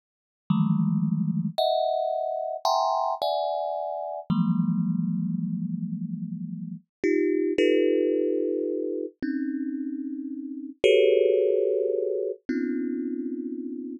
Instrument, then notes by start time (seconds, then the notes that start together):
kalimba
0.50 D#3 E3 F3 G3 G#3 A3
1.58 D#5 E5 F#5
2.65 E5 F#5 G5 G#5 A#5 C6
3.22 D5 E5 F#5 G#5
4.30 E3 F3 F#3 G#3 A#3
7.04 D#4 F4 G4
7.58 D#4 F4 G4 A4 B4
9.22 C4 C#4 D#4
10.84 F#4 G4 G#4 A4 B4 C#5
12.49 B3 C4 C#4 D#4 F4